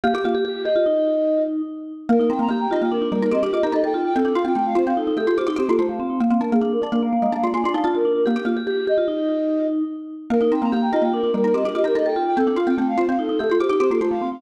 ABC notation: X:1
M:5/4
L:1/16
Q:1/4=146
K:Eblyd
V:1 name="Flute"
G4 G G e8 z6 | B2 g b b g e g B2 B B e G e B e g2 g | A2 f g g f c f A2 A A c G c A c f2 f | f2 B _A A B d B f2 f f d _a d f d B2 B |
G4 G G e8 z6 | B2 g b b g e g B2 B B e G e B e g2 g | A2 f g g f c f A2 A A c G c A c f2 f |]
V:2 name="Vibraphone"
G G F G G2 G F E8 z4 | z E C2 G2 F2 D D B, B, C D F G A A F2 | z D F2 A,2 C2 E E G G F E C B, A, A, C2 | z C B,2 D2 D2 B, B, B, B, B, B, D E F F D2 |
G G F G G2 G F E8 z4 | z E C2 G2 F2 D D B, B, C D F G A A F2 | z D F2 A,2 C2 E E G G F E C B, A, A, C2 |]
V:3 name="Xylophone"
B, G B,8 z10 | B, B, E B, B,2 E B,3 G, E G G G E E4 | C C F C C2 F C3 A, F G G G F F4 | B, B, D B, B,2 D B,3 _A, D F F F D D4 |
B, G B,8 z10 | B, B, E B, B,2 E B,3 G, E G G G E E4 | C C F C C2 F C3 A, F G G G F F4 |]